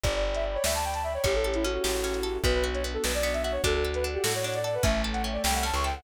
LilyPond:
<<
  \new Staff \with { instrumentName = "Flute" } { \time 6/8 \key d \major \tempo 4. = 100 d''16 d''16 r16 e''16 r16 cis''16 e''16 a''16 g''16 a''16 e''16 cis''16 | g'16 a'16 g'16 e'16 fis'16 fis'4.~ fis'16 | b'16 b'16 r16 cis''16 r16 a'16 b'16 d''16 d''16 e''16 e''16 cis''16 | a'16 a'16 r16 b'16 r16 g'16 a'16 cis''16 cis''16 d''16 d''16 b'16 |
e''16 e''16 r16 fis''16 r16 d''16 g''16 fis''16 a''16 cis'''16 g''16 fis''16 | }
  \new Staff \with { instrumentName = "Marimba" } { \time 6/8 \key d \major d''2~ d''8 r8 | cis''2~ cis''8 r8 | fis'4 r2 | fis'2~ fis'8 r8 |
a2~ a8 r8 | }
  \new Staff \with { instrumentName = "Pizzicato Strings" } { \time 6/8 \key d \major r2. | cis'8 a'8 cis'8 g'8 cis'8 a'8 | b8 fis'8 b8 d'8 b8 fis'8 | d'8 a'8 d'8 fis'8 d'8 a'8 |
cis'8 a'8 cis'8 g'8 cis'8 a'8 | }
  \new Staff \with { instrumentName = "Electric Bass (finger)" } { \clef bass \time 6/8 \key d \major g,,4. d,4. | a,,4. a,,4. | b,,4. b,,4. | d,4. a,4. |
a,,4. c,8. cis,8. | }
  \new Staff \with { instrumentName = "Pad 2 (warm)" } { \time 6/8 \key d \major <d'' g'' b''>2. | <cis' e' g' a'>2. | <b d' fis'>2. | <a' d'' fis''>2. |
<a' cis'' e'' g''>2. | }
  \new DrumStaff \with { instrumentName = "Drums" } \drummode { \time 6/8 <hh bd>8. hh8. sn8. hh8. | <hh bd>8. hh8. sn8. hh8. | <hh bd>8. hh8. sn8. hh8. | <hh bd>8. hh8. sn8. hh8. |
<hh bd>8. hh8. sn8. hh8. | }
>>